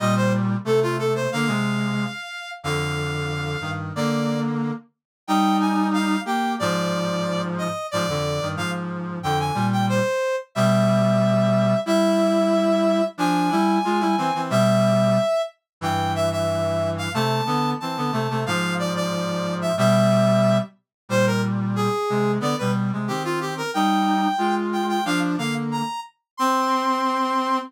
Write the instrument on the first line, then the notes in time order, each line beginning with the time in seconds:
brass section
0.00 A#2 G3 D#5
0.16 C5
0.65 C3 A3 A4
0.82 F4
0.99 A4
1.15 C5
1.32 D3 A#3 F5
1.47 C3 G#3
2.63 F2 D3 F5
3.61 G2 D#3
3.96 D3 A#3 D5
5.27 G3 D#4 G5
5.60 G#5
5.93 F5
6.25 A#3 G4 G5
6.59 G#2 F3 D5
7.58 D#5
7.91 G#2 F3 D5
8.09 F2 D3
8.41 G2 D#3
8.56 G#2 F3 F5
9.23 F2 D3 G5
9.40 G#5
9.54 A#2 G3
9.73 G5
9.89 C5
10.55 B2 G3 E5
11.86 G3 E4 E5
13.18 F3 D4 G#5
13.51 G3 E4
13.84 G#3 F4
14.00 G3 E4
14.18 E3 C4
14.35 E3 C4
14.50 B2 G3 E5
15.81 G2 E3 G5
16.15 E5
16.32 E5
16.98 F5
17.14 C3 A3 A5
17.46 D3 B3
17.80 E3 C4 A5
17.97 D3 B3
18.12 C3 A3
18.30 C3 A3
18.46 G#2 F3 F5
18.79 D5
18.96 D5
19.62 E5
19.77 B2 G3 E5
21.09 A#2 G3 C5
21.26 A#4
21.76 G#4
22.10 C3 G#3
22.40 D3 B3 D5
22.58 B2 G3 B4
22.93 C3 G#3
23.08 D#3 C4 G4
23.24 F4
23.41 G4
23.57 A#4
23.74 G3 D#4 G5
24.38 G#3 F4
24.73 G5
24.89 G5
25.05 F3 D4 F5
25.38 D3 A#3 F5
25.71 A#5
26.37 C4 C6